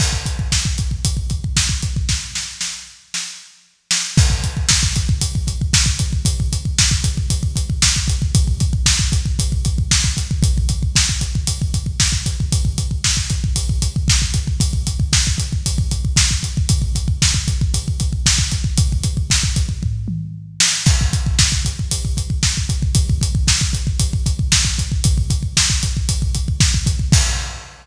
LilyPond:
\new DrumStaff \drummode { \time 4/4 \tempo 4 = 115 <cymc bd>16 bd16 <hh bd>16 bd16 <bd sn>16 bd16 <hh bd>16 bd16 <hh bd>16 bd16 <hh bd>16 bd16 <bd sn>16 bd16 <hh bd>16 bd16 | <bd sn>8 sn8 sn4 sn4 r8 sn8 | <cymc bd>16 bd16 <hh bd>16 bd16 <bd sn>16 bd16 <hh bd>16 bd16 <hh bd>16 bd16 <hh bd>16 bd16 <bd sn>16 bd16 <hh bd>16 bd16 | <hh bd>16 bd16 <hh bd>16 bd16 <bd sn>16 bd16 <hh bd>16 bd16 <hh bd>16 bd16 <hh bd>16 bd16 <bd sn>16 bd16 <hh bd>16 bd16 |
<hh bd>16 bd16 <hh bd>16 bd16 <bd sn>16 bd16 <hh bd>16 bd16 <hh bd>16 bd16 <hh bd>16 bd16 <bd sn>16 bd16 <hh bd>16 bd16 | <hh bd>16 bd16 <hh bd>16 bd16 <bd sn>16 bd16 <hh bd>16 bd16 <hh bd>16 bd16 <hh bd>16 bd16 <bd sn>16 bd16 <hh bd>16 bd16 | <hh bd>16 bd16 <hh bd>16 bd16 <bd sn>16 bd16 <hh bd>16 bd16 <hh bd>16 bd16 <hh bd>16 bd16 <bd sn>16 bd16 <hh bd>16 bd16 | <hh bd>16 bd16 <hh bd>16 bd16 <bd sn>16 bd16 <hh bd>16 bd16 <hh bd>16 bd16 <hh bd>16 bd16 <bd sn>16 bd16 <hh bd>16 bd16 |
<hh bd>16 bd16 <hh bd>16 bd16 <bd sn>16 bd16 <hh bd>16 bd16 <hh bd>16 bd16 <hh bd>16 bd16 <bd sn>16 bd16 <hh bd>16 bd16 | <hh bd>16 bd16 <hh bd>16 bd16 <bd sn>16 bd16 <hh bd>16 bd16 <bd tomfh>8 toml8 r8 sn8 | <cymc bd>16 bd16 <hh bd>16 bd16 <bd sn>16 bd16 <hh bd>16 bd16 <hh bd>16 bd16 <hh bd>16 bd16 <bd sn>16 bd16 <hh bd>16 bd16 | <hh bd>16 bd16 <hh bd>16 bd16 <bd sn>16 bd16 <hh bd>16 bd16 <hh bd>16 bd16 <hh bd>16 bd16 <bd sn>16 bd16 <hh bd>16 bd16 |
<hh bd>16 bd16 <hh bd>16 bd16 <bd sn>16 bd16 <hh bd>16 bd16 <hh bd>16 bd16 <hh bd>16 bd16 <bd sn>16 bd16 <hh bd>16 bd16 | <cymc bd>4 r4 r4 r4 | }